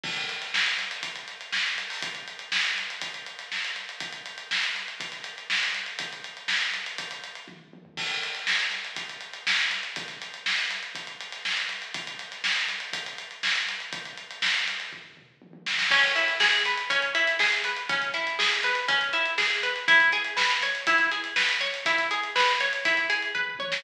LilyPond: <<
  \new Staff \with { instrumentName = "Acoustic Guitar (steel)" } { \time 4/4 \key cis \minor \tempo 4 = 121 r1 | r1 | r1 | r1 |
r1 | r1 | r1 | r1 |
cis'8 e'8 gis'8 b'8 cis'8 e'8 gis'8 b'8 | cis'8 e'8 gis'8 b'8 cis'8 e'8 gis'8 b'8 | e'8 gis'8 b'8 cis''8 e'8 gis'8 b'8 cis''8 | e'8 gis'8 b'8 cis''8 e'8 gis'8 b'8 cis''8 | }
  \new DrumStaff \with { instrumentName = "Drums" } \drummode { \time 4/4 <cymc bd>16 hh16 hh16 <hh sn>16 sn16 hh16 hh16 hh16 <hh bd>16 hh16 <hh sn>16 hh16 sn16 hh16 hh16 hho16 | <hh bd>16 hh16 hh16 hh16 sn16 hh16 hh16 hh16 <hh bd>16 hh16 hh16 <hh sn>16 sn16 hh16 hh16 hh16 | <hh bd>16 hh16 hh16 hh16 sn16 hh16 hh16 hh16 <hh bd>16 <hh sn>16 hh16 hh16 sn16 <hh sn>16 hh16 hh16 | <hh bd>16 hh16 hh16 hh16 sn16 hh16 hh16 hh16 <hh bd>16 hh16 hh16 hh16 <bd tommh>8 tommh16 tomfh16 |
<cymc bd>16 hh16 hh16 hh16 sn16 hh16 hh16 hh16 <hh bd>16 hh16 hh16 hh16 sn16 <hh sn>16 <hh sn>16 <hh sn>16 | <hh bd>16 <hh sn>16 hh16 hh16 sn16 hh16 <hh sn>16 hh16 <hh bd>16 hh16 hh16 <hh sn>16 sn16 <hh sn>16 hh16 hh16 | <hh bd>16 hh16 <hh sn>16 <hh sn>16 sn16 hh16 <hh sn>16 hh16 <hh bd>16 hh16 hh16 hh16 sn16 hh16 hh16 hh16 | <hh bd>16 hh16 hh16 hh16 sn16 hh16 <hh sn>16 <hh sn>16 <bd tomfh>16 tomfh16 toml8 tommh16 tommh16 sn16 sn16 |
<cymc bd>16 <hh sn>16 hh16 hh16 sn16 hh16 hh16 hh16 <hh bd>16 hh16 hh16 hh16 sn16 hh16 hh16 hh16 | <hh bd>16 hh16 <hh sn>16 hh16 sn16 hh16 <hh sn>16 hh16 <hh bd>16 hh16 <hh sn>16 hh16 sn16 hh16 hh16 hh16 | <hh bd>16 hh16 hh16 hh16 sn16 hh16 hh16 hh16 <hh bd>16 <hh sn>16 hh16 hh16 sn16 hh16 hh16 <hh sn>16 | <hh bd>16 hh16 hh16 hh16 sn16 hh16 hh16 hh16 <hh bd>16 hh16 hh16 hh16 <bd tomfh>16 toml16 tommh16 sn16 | }
>>